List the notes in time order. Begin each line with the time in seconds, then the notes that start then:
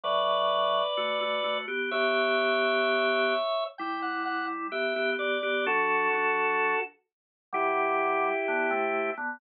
0.04 A2 F#3 B4 D5
0.97 A3 F#4
1.21 A3 F#4
1.44 A3 F#4
1.68 B3 G4
1.91 B3 G4 C#5 E5
3.78 G3 E4 G5
4.02 F#5
4.25 F#5
4.72 B3 G4 E5
4.96 B3 G4
5.18 B3 G4 D5
5.43 B3 G4
5.66 F#3 D4 F#4 A4
6.13 F#3 D4
7.53 B2 G3 E4 G4
8.48 D3 B3
8.71 C3 A3
9.17 D3 B3